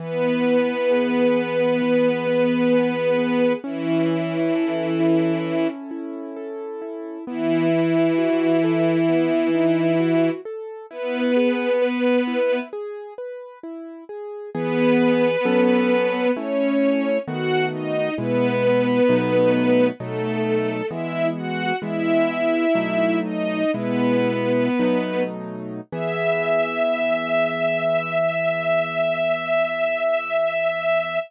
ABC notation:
X:1
M:4/4
L:1/8
Q:1/4=66
K:E
V:1 name="String Ensemble 1"
[B,B]8 | [E,E]5 z3 | [E,E]8 | [B,B]4 z4 |
[B,B]4 [Cc]2 [Ff] [Dd] | [B,B]4 [A,A]2 [Ee] [Ff] | "^rit." [Ee]3 [Dd] [B,B]3 z | e8 |]
V:2 name="Acoustic Grand Piano"
E, B, G B, E, B, G B, | C E A E C E A E | B, E F A B, D F A | E G B E G B E G |
[E,B,G]2 [F,CA]2 [A,CE]2 [D,A,B,F]2 | [B,,G,E]2 [B,,F,A,D]2 [B,,F,A,D]2 [E,G,B,]2 | "^rit." [E,G,B,]2 [B,,F,A,D]2 [B,,G,E]2 [B,,F,A,D]2 | [E,B,G]8 |]